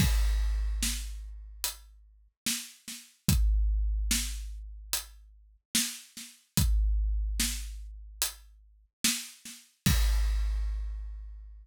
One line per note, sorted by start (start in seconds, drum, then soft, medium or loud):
0.00 kick loud
0.00 crash medium
0.83 snare medium
1.64 closed hi-hat medium
2.46 snare medium
2.88 snare medium
3.28 kick loud
3.28 closed hi-hat medium
4.11 snare loud
4.93 closed hi-hat medium
5.75 snare loud
6.17 snare medium
6.57 kick loud
6.57 closed hi-hat medium
7.40 snare loud
8.22 closed hi-hat loud
9.04 snare loud
9.45 snare soft
9.86 kick loud
9.86 crash loud